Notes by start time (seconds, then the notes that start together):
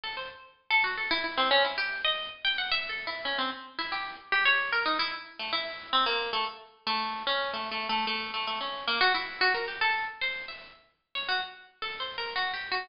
0.04 A4
0.17 C5
0.71 A4
0.84 F#4
0.98 A4
1.11 E4
1.24 E4
1.38 C4
1.51 C#4
1.65 E4
1.78 G4
2.05 D#5
2.45 G5
2.58 F#5
2.72 E5
2.89 A4
3.07 E4
3.25 C#4
3.39 C4
3.79 E4
3.92 G4
4.32 G4
4.45 C#5
4.72 A#4
4.86 D#4
4.99 E4
5.39 A3
5.53 E4
5.93 C4
6.06 A#3
6.33 A3
6.87 A3
7.27 C#4
7.54 A3
7.72 A3
7.89 A3
8.07 A3
8.34 A3
8.47 A3
8.61 C#4
8.87 A#3
9.01 F#4
9.14 E4
9.41 F#4
9.54 A#4
9.68 G4
9.81 A4
10.21 C5
10.48 E5
11.15 C#5
11.29 F#4
11.82 A4
12.00 C5
12.18 A#4
12.36 F#4
12.54 G4
12.72 F#4